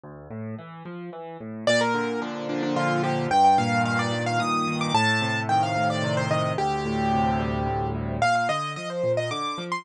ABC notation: X:1
M:3/4
L:1/16
Q:1/4=110
K:Gm
V:1 name="Acoustic Grand Piano"
z12 | d B3 D2 D D F2 G2 | g g f2 f d2 f e'3 d' | a4 g f2 d2 c e2 |
G10 z2 | f f e2 e c2 e d'3 c' |]
V:2 name="Acoustic Grand Piano" clef=bass
D,,2 A,,2 =E,2 F,2 E,2 A,,2 | B,,2 D,2 F,2 B,,2 D,2 F,2 | G,,2 B,,2 E,2 G,,2 B,,2 E,2 | A,,2 C,2 E,2 A,,2 C,2 E,2 |
D,,2 A,,2 C,2 G,2 D,,2 A,,2 | B,,2 D,2 F,2 B,,2 D,2 F,2 |]